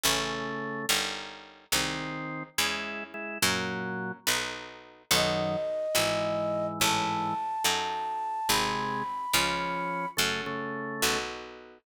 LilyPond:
<<
  \new Staff \with { instrumentName = "Flute" } { \time 6/8 \key e \major \tempo 4. = 71 r2. | r2. | r2. | dis''2. |
a''2. | b''2. | r2. | }
  \new Staff \with { instrumentName = "Drawbar Organ" } { \time 6/8 \key e \major <cis a>4. r4. | <dis bis>4. <gis e'>4 <gis e'>8 | <ais, fis>4. r4. | <fis, dis>4 r8 <gis, e>4. |
<gis, e>4 r2 | <bis, gis>4 r8 <eis cis'>4. | <cis a>8 <cis a>4. r4 | }
  \new Staff \with { instrumentName = "Acoustic Guitar (steel)" } { \time 6/8 \key e \major <cis' e' a'>4. <cis' dis' g' ais'>4. | <bis dis' gis'>4. <cis' e' gis'>4. | <cis' fis' ais'>4. <dis' fis' a' b'>4. | <dis' fis' a' b'>4. <e' gis' b'>4. |
<e' a' cis''>4. <dis' fis' a'>4. | <bis dis' gis'>4. <cis' eis' gis'>4. | <cis' fis' a'>4. <b dis' fis' a'>4. | }
  \new Staff \with { instrumentName = "Harpsichord" } { \clef bass \time 6/8 \key e \major a,,4. g,,4. | bis,,4. e,4. | fis,4. b,,4. | b,,4. gis,,4. |
a,,4. fis,4. | gis,,4. cis,4. | fis,4. b,,4. | }
>>